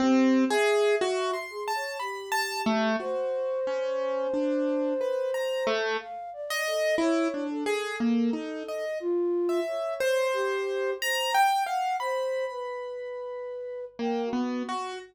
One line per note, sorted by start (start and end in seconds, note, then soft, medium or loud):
0.00 0.45 C4 loud
0.00 0.45 G4 medium
0.50 0.95 G#4 loud
0.50 1.40 E5 medium
1.01 1.31 F#4 loud
1.34 1.64 C6 medium
1.50 1.72 G#4 medium
1.68 1.98 A5 medium
1.75 1.97 C#5 medium
2.00 2.90 G4 medium
2.00 2.30 B5 medium
2.32 2.62 A5 loud
2.66 2.96 A3 loud
3.00 3.60 F#4 medium
3.00 5.70 C5 loud
3.67 4.27 C#4 medium
4.34 4.94 D4 medium
5.01 5.31 B4 medium
5.34 5.64 A#5 medium
5.67 5.97 A3 loud
6.00 6.30 F5 medium
6.33 6.63 D5 medium
6.50 6.95 D#5 loud
6.66 6.96 A4 medium
6.98 7.28 E4 loud
6.98 7.45 C#5 medium
7.34 7.64 D4 medium
7.50 8.85 A4 medium
7.66 7.96 G#4 loud
8.00 8.30 A#3 medium
8.33 8.63 D#4 medium
8.68 8.98 D#5 medium
9.00 9.60 F4 loud
9.49 9.94 E5 medium
9.67 10.27 C#5 medium
10.00 10.90 C5 loud
10.34 10.94 G4 loud
11.00 11.30 C5 medium
11.00 11.32 A#5 loud
11.34 11.64 G5 loud
11.66 11.96 F5 medium
11.66 11.96 F#5 loud
12.00 12.45 C5 loud
12.00 13.80 B5 medium
12.50 13.85 B4 medium
13.99 14.29 A#3 medium
13.99 14.23 G5 medium
14.25 14.93 F#4 medium
14.33 14.63 B3 medium
14.69 14.99 F#4 medium